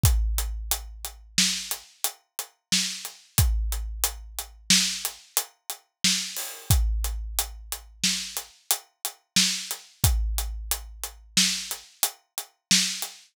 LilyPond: \new DrumStaff \drummode { \time 5/4 \tempo 4 = 90 <hh bd>8 hh8 hh8 hh8 sn8 hh8 hh8 hh8 sn8 hh8 | <hh bd>8 hh8 hh8 hh8 sn8 hh8 hh8 hh8 sn8 hho8 | <hh bd>8 hh8 hh8 hh8 sn8 hh8 hh8 hh8 sn8 hh8 | <hh bd>8 hh8 hh8 hh8 sn8 hh8 hh8 hh8 sn8 hh8 | }